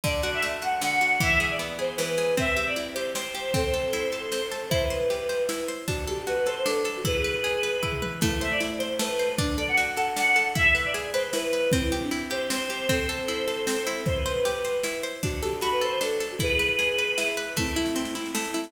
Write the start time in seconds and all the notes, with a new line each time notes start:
0.04 D3 D5, kick, snare
0.22 F#4 D5, snare
0.34 E5
0.42 A3, snare
0.62 F#4 F#5, snare
0.81 D3 F#5, snare
1.01 F#4, snare
1.20 E3 E5, kick, snare
1.40 G#4 E5, snare
1.50 D5
1.59 B3, snare
1.79 G#4 C5, snare
1.97 E3 B4, snare
2.17 G#4, snare
2.37 C4 E5, kick, snare
2.57 G4 E5, snare
2.66 D5
2.76 E4, snare
2.94 G4 C5, snare
3.15 C4 C5, snare
3.34 G4, snare
3.54 C4 A4 C5, kick, snare
3.73 A4, snare
3.93 E4, snare
4.12 A4, snare
4.32 C4, snare
4.51 A4, snare
4.69 E4 C5, kick, snare
4.82 B4
4.90 C5, snare
5.10 G4, snare
5.29 C5, snare
5.49 E4, snare
5.68 C5, snare
5.88 D4 F#4, kick, snare
6.07 G4 A4, snare
6.27 F#4 B4, snare
6.37 B4
6.46 A4 C5, snare
6.55 C5
6.64 D4 A4, snare
6.84 A4, snare
6.97 F#4
7.05 E4 G#4 B4, kick, snare
7.24 B4, snare
7.44 G#4, snare
7.63 B4, snare
7.83 E4, kick
7.92 mid tom
8.02 B4, high tom
8.21 A3 E4, kick, snare, crash
8.41 C5 E5, snare
8.51 D5
8.60 E4, snare
8.78 C5, snare
8.99 A3 B4, snare
9.19 C5, snare
9.38 D4, kick, snare
9.58 A4 D5, snare
9.68 F#5
9.77 F#4, snare
9.96 A4 F#5, snare
10.16 D4 F#5, snare
10.36 A4, snare
10.55 E4 E5, kick, snare
10.75 B4 E5, snare
10.85 D5
10.94 G#4, snare
11.13 B4 C5, snare
11.33 E4 B4, snare
11.53 B4, snare
11.72 C4 E4, kick, snare
11.92 E4 G4, snare
12.02 D4
12.11 E4, snare
12.30 G4 C5, snare
12.50 C4 C5, snare
12.69 G4, snare
12.89 C4 A4 C5, kick, snare
13.09 A4, snare
13.28 E4, snare
13.48 A4, snare
13.67 C4, snare
13.87 E4, snare
14.06 C5, kick, snare
14.16 B4
14.26 C5, snare
14.45 G4, snare
14.64 C5, snare
14.83 E4, snare
15.03 C5, snare
15.23 D4 F#4, kick, snare
15.42 G4 A4, snare
15.61 F#4 B5, snare
15.71 B4
15.81 A4 C5, snare
15.92 C5
16.01 D4 A4, snare
16.20 A4, snare
16.31 F#4
16.39 E4 G#4 B4, kick, snare
16.59 B4, snare
16.79 G#4, snare
16.98 B4, snare
17.18 E4, snare
17.37 B4, snare
17.56 A3 C4 E4, kick, snare
17.67 snare
17.76 E4, snare
17.86 snare
17.95 C4, snare
18.05 snare
18.15 E4, snare
18.25 snare
18.35 A3, snare
18.44 snare
18.54 E4, snare
18.64 snare